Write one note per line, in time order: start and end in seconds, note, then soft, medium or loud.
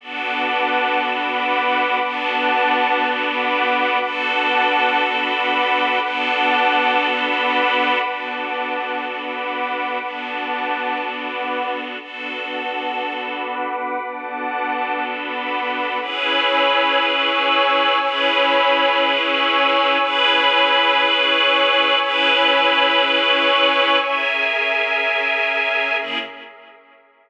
0.01 1.99 B3 medium
0.01 1.99 D4 medium
0.01 1.99 F#4 medium
0.01 1.99 A4 medium
0.01 0.99 B4 medium
0.01 0.99 F#5 medium
0.01 0.99 A5 medium
0.01 0.99 D6 medium
1.00 1.99 B4 medium
1.00 1.99 F#5 medium
1.00 1.99 B5 medium
1.00 1.99 D6 medium
2.00 3.98 B3 medium
2.00 3.98 D4 medium
2.00 3.98 F#4 medium
2.00 3.98 A4 medium
2.00 2.99 B4 medium
2.00 2.99 F#5 medium
2.00 2.99 A5 medium
2.00 2.99 D6 medium
3.00 3.99 B4 medium
3.00 3.99 F#5 medium
3.00 3.99 B5 medium
3.00 3.99 D6 loud
4.00 6.00 B3 medium
4.00 6.00 D4 medium
4.00 6.00 F#4 medium
4.00 6.00 A4 medium
4.00 4.99 B4 medium
4.00 4.99 F#5 loud
4.00 4.99 A5 loud
4.00 4.99 D6 medium
5.00 5.99 B4 medium
5.00 5.99 F#5 medium
5.00 5.99 B5 medium
5.00 5.99 D6 medium
6.00 7.98 B3 medium
6.00 7.98 D4 medium
6.00 7.98 F#4 medium
6.00 7.98 A4 medium
6.00 6.99 B4 medium
6.00 6.99 F#5 loud
6.00 6.99 A5 medium
6.00 6.99 D6 medium
7.00 7.99 B4 medium
7.00 7.99 F#5 medium
7.00 7.99 B5 loud
7.00 7.99 D6 medium
8.00 9.99 B3 medium
8.00 9.99 D4 soft
8.00 9.99 F#4 medium
8.00 9.99 A4 medium
8.00 8.99 B4 medium
8.00 8.99 F#5 medium
8.00 8.99 A5 medium
8.00 8.99 D6 medium
9.00 9.99 B4 medium
9.00 9.99 F#5 medium
9.00 9.99 B5 medium
9.00 9.99 D6 medium
10.00 11.98 B3 medium
10.00 11.98 D4 medium
10.00 11.98 F#4 medium
10.00 11.98 A4 soft
10.00 10.99 B4 medium
10.00 10.99 F#5 medium
10.00 10.99 A5 medium
10.00 10.99 D6 medium
11.00 11.99 B4 medium
11.00 11.99 F#5 medium
11.00 11.99 B5 medium
11.00 11.99 D6 medium
11.99 13.98 B3 soft
11.99 13.98 D4 soft
11.99 13.98 F#4 medium
11.99 13.98 A4 medium
11.99 12.98 B4 medium
11.99 12.98 F#5 medium
11.99 12.98 A5 medium
11.99 12.98 D6 medium
13.00 13.99 B4 medium
13.00 13.99 F#5 medium
13.00 13.99 B5 medium
13.00 13.99 D6 medium
14.01 15.99 B3 medium
14.01 15.99 D4 medium
14.01 15.99 F#4 soft
14.01 15.99 A4 medium
14.01 14.99 B4 medium
14.01 14.99 F#5 medium
14.01 15.00 A5 medium
14.01 14.99 D6 medium
15.00 15.99 B4 medium
15.00 15.99 F#5 medium
15.00 15.99 B5 medium
15.00 15.99 D6 medium
16.00 17.98 C#4 medium
16.00 17.98 E4 medium
16.00 17.98 G#4 medium
16.00 17.98 B4 medium
16.00 16.99 C#5 loud
16.00 16.99 G#5 loud
16.00 16.99 B5 medium
16.00 16.99 E6 loud
17.00 17.99 C#5 loud
17.00 17.99 G#5 loud
17.00 17.99 C#6 loud
17.00 17.99 E6 loud
18.00 19.98 C#4 medium
18.00 19.98 E4 medium
18.00 19.98 G#4 medium
18.00 19.98 B4 medium
18.00 18.99 C#5 loud
18.00 18.99 G#5 loud
18.00 18.99 B5 loud
18.00 18.99 E6 loud
19.00 19.99 C#5 loud
19.00 19.99 G#5 loud
19.00 19.99 C#6 medium
19.00 19.99 E6 loud
20.00 21.98 C#4 medium
20.00 21.98 E4 medium
20.00 21.98 G#4 medium
20.00 21.98 B4 loud
20.00 20.99 C#5 loud
20.00 20.99 G#5 loud
20.00 20.99 B5 loud
20.00 20.99 E6 loud
21.00 21.99 C#5 loud
21.00 21.99 G#5 loud
21.00 21.99 C#6 loud
21.00 21.99 E6 medium
21.99 23.98 C#4 medium
21.99 23.98 E4 medium
21.99 23.98 G#4 medium
21.99 23.98 B4 loud
21.99 22.98 C#5 loud
21.99 22.98 G#5 loud
21.99 22.98 B5 loud
21.99 22.98 E6 loud
23.01 24.00 C#5 loud
23.01 24.00 G#5 loud
23.01 24.00 C#6 loud
23.01 24.00 E6 medium
23.99 25.97 C#4 medium
23.99 25.98 C#4 medium
23.99 25.98 G#4 medium
23.99 25.97 A#4 medium
23.99 25.98 A#4 medium
23.99 25.97 E5 medium
23.99 25.98 E5 medium
23.99 25.97 G#5 medium
26.00 26.18 C#3 medium
26.00 26.18 A#3 medium
26.00 26.17 C#4 medium
26.00 26.18 E4 medium
26.00 26.17 G#4 medium
26.00 26.18 G#4 medium
26.00 26.17 A#4 medium
26.00 26.17 E5 medium